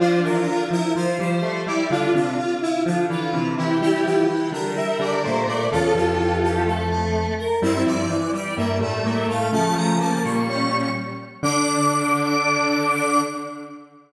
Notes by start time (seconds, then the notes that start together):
0.00 F3 D4 F4 C5
0.24 E3 F3 F4 A#4
0.48 D3 F4
0.71 F3 E4 A#4
0.95 F3 F4 C5
1.19 F3 G3 G4 C5
1.42 G3 A3 G4
1.67 G3 E4 G4 D5
1.90 D3 D4 F4
2.14 C3 D3 D4 F4
2.38 F4
2.62 E4 F4
2.86 D3 F3 D4 F4
3.09 D3 E3 E4 F4
3.32 C3 E3 E4
3.57 E3 E4 G4
3.81 E3 G3 E4 G4
4.04 E3 F3 E4 G4
4.28 E3 E4
4.52 D3 G3 D4 A#4
4.76 G3 E5
4.99 D3 G3 D4 D5
5.24 A#2 A3 A#3 C5
5.47 A#2 A3 A#3 D5
5.71 E2 C#3 E3 F4 A4
5.94 F2 E3 F3 G4
6.19 E3
6.43 G4
6.66 A3 A4
6.90 A4
7.38 A#4
7.62 G2 G3 C4 E4 E5
7.86 G2 F3 G3 D5
8.10 E3
8.33 G3 D5
8.57 G2 G3 A#3 E5
8.79 A2 G3 A3 E5
9.04 A2 A3 A#3
9.28 A2 A3 F5
9.52 C#3 F3 A3 C#4 A5
9.76 F3 A#5
10.00 A#3 A5
10.24 A#2 G3 A#3 C#6
10.48 C#4 C#6
11.43 D3 D4 D6